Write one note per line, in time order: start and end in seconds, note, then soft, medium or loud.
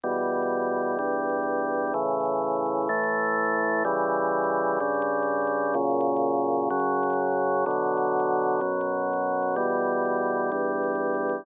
0.04 0.98 E2 medium
0.04 0.98 B2 medium
0.04 0.98 G3 medium
0.99 1.93 E2 medium
0.99 1.93 G2 medium
0.99 1.93 G3 medium
1.94 2.88 A2 medium
1.94 2.88 C#3 medium
1.94 2.88 E3 medium
2.89 3.83 A2 medium
2.89 3.83 E3 medium
2.89 3.83 A3 medium
3.85 4.79 C#3 medium
3.85 4.79 E3 medium
3.85 4.79 G3 medium
4.80 5.74 G2 medium
4.80 5.74 C#3 medium
4.80 5.74 G3 medium
5.75 6.69 F#2 medium
5.75 6.69 A#2 medium
5.75 6.69 C#3 medium
6.70 7.65 F#2 medium
6.70 7.65 C#3 medium
6.70 7.65 F#3 medium
7.66 8.60 B2 medium
7.66 8.60 D3 medium
7.66 8.60 F#3 medium
8.61 9.55 F#2 medium
8.61 9.55 B2 medium
8.61 9.55 F#3 medium
9.56 10.50 E2 medium
9.56 10.50 B2 medium
9.56 10.50 G3 medium
10.52 11.45 E2 medium
10.52 11.45 G2 medium
10.52 11.45 G3 medium